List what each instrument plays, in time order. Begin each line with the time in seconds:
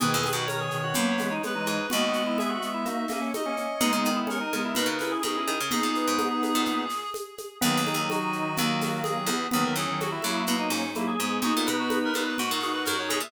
0.00 harpsichord G#2, clarinet B2 D#3 B4, drawbar organ G#4, low conga, shaker
0.14 harpsichord E2
0.24 high conga, shaker
0.33 harpsichord F#2, drawbar organ F#4
0.46 drawbar organ A#4, clarinet C#5, high conga, shaker
0.60 drawbar organ G#4
0.71 clarinet B2 D#3, shaker
0.84 drawbar organ F#4
0.94 harpsichord F#2, clarinet F#3 A#3, drawbar organ B3, low conga, shaker
1.18 clarinet E3 G#3, drawbar organ B3, snare, high conga, shaker
1.31 drawbar organ D#4
1.43 clarinet G#3 B3 B4, high conga, shaker
1.55 clarinet E3 G#3, drawbar organ D#4
1.66 harpsichord G#2, drawbar organ D#4, shaker
1.90 harpsichord D#2, clarinet G#3 B3 D#5, drawbar organ F#4, low conga, shaker
2.13 shaker
2.27 drawbar organ E4
2.38 drawbar organ G#4, clarinet E5, high conga, shaker
2.49 drawbar organ F#4
2.62 clarinet G#3 B3, shaker
2.74 drawbar organ E4
2.85 drawbar organ A#3, clarinet D#4 F#4, low conga, shaker
3.08 drawbar organ A#3, clarinet A#3 C#4, snare, high conga, shaker
3.22 drawbar organ C#4
3.34 clarinet D#4 F#4 D#5, high conga, shaker
3.45 clarinet A#3 C#4, drawbar organ C#4
3.57 drawbar organ C#4, shaker
3.80 harpsichord B2, clarinet G#3 B3 G#4, drawbar organ D#4, low conga, shaker
3.93 harpsichord C#3
4.05 harpsichord D#3, shaker
4.16 drawbar organ E4
4.27 drawbar organ C#4, clarinet A#4, high conga, shaker
4.41 drawbar organ D#4
4.53 harpsichord C#3, clarinet G#3 B3, high conga, shaker
4.65 drawbar organ E4
4.75 harpsichord B2, clarinet D#4 F#4, drawbar organ B4, low conga, shaker
4.86 harpsichord C#3
4.99 clarinet C#4 E4, drawbar organ B4, snare, high conga, shaker
5.12 drawbar organ G#4
5.23 harpsichord B2, clarinet D#4 F#4 G#4, high conga, shaker
5.35 clarinet C#4 E4, drawbar organ G#4
5.47 harpsichord D#3, drawbar organ G#4, high conga, shaker
5.60 harpsichord C#3
5.71 harpsichord B2, clarinet B3 D#4 G#4, drawbar organ G#4, low conga, shaker
5.83 harpsichord A#2
5.95 drawbar organ B4, shaker
6.08 harpsichord G#2
6.18 drawbar organ B3, high conga, shaker
6.43 high conga, shaker
6.55 harpsichord A#2
6.65 low conga, shaker
6.89 snare, shaker
7.14 high conga, shaker
7.38 high conga, shaker
7.61 harpsichord D#2, clarinet D#3 F#3 G#4, drawbar organ B3, low conga, shaker
7.77 harpsichord D#2
7.86 drawbar organ D#4, high conga, shaker
7.94 harpsichord D#2
8.10 clarinet F#4, high conga, shaker
8.33 shaker
8.56 harpsichord D#2, drawbar organ A#3, low conga, shaker
8.81 snare, high conga, shaker
9.03 clarinet G#4, high conga, shaker
9.26 harpsichord E2, drawbar organ B3, high conga, shaker
9.51 harpsichord D#2, clarinet D#3 F#3 G#4, drawbar organ B3, low conga, shaker
9.64 clarinet D#3 F#3 A#4
9.75 harpsichord E2, drawbar organ C#4, clarinet G#4, shaker
9.88 clarinet D#3 F#3
10.00 clarinet F#4, high conga, shaker
10.11 drawbar organ E4, clarinet F#4
10.22 harpsichord F#2, clarinet F#3 A#3, high conga, shaker
10.47 harpsichord B2, low conga, shaker
10.59 drawbar organ D#4
10.70 harpsichord G#2, drawbar organ C#4, snare, shaker
10.94 clarinet F#3 A#3, drawbar organ E4, high conga, shaker
11.08 drawbar organ G#4
11.19 harpsichord G#2, clarinet G#3 B3, shaker
11.42 harpsichord G#2, clarinet B3 D#4 F#4, drawbar organ G#4, low conga, shaker
11.57 harpsichord A#2
11.66 harpsichord B2, drawbar organ B4, high conga, shaker
11.79 clarinet F#4
11.90 high conga, shaker
12.04 clarinet A#4
12.14 harpsichord A#2, clarinet B3 D#4, high conga, shaker
12.27 clarinet B4
12.37 harpsichord G#2, clarinet D#4 F#4, drawbar organ F#4, low conga, shaker
12.51 harpsichord A#2
12.60 clarinet D#4 F#4 G#4, snare, shaker
12.73 clarinet B4
12.84 harpsichord F#2, clarinet D#4 F#4 A#4, high conga, shaker
12.97 clarinet D#4 F#4 C#5
13.09 harpsichord B2, drawbar organ G#4, high conga, shaker
13.20 harpsichord A#2, clarinet E5